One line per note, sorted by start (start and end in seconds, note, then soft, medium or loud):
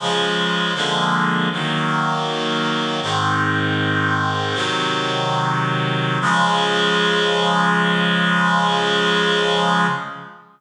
0.00 0.74 C#3 medium
0.00 0.74 F3 medium
0.00 0.74 G#3 medium
0.75 1.49 D3 medium
0.75 1.49 F3 medium
0.75 1.49 G#3 medium
0.75 1.49 A#3 medium
1.52 3.00 D#3 medium
1.52 3.00 F#3 medium
1.52 3.00 A#3 medium
3.02 4.55 G#2 medium
3.02 4.54 D#3 medium
3.02 4.55 C4 medium
4.54 6.18 C3 medium
4.54 6.18 D#3 medium
4.54 6.18 F#3 medium
6.21 9.87 C#3 loud
6.21 9.87 F3 medium
6.21 9.87 G#3 loud